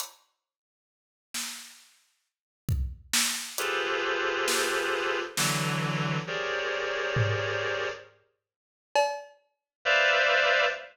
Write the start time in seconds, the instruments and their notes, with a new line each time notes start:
0.00 closed hi-hat
1.34 snare
2.69 kick
3.13 snare
3.58 clarinet F4 G4 G#4 A4 B4 C5, closed hi-hat
4.48 snare
5.37 clarinet D3 E3 F#3, snare
6.27 clarinet G4 G#4 A#4 C5 C#5 D5
7.16 floor tom
8.96 cowbell
9.85 clarinet B4 C5 D5 E5 F5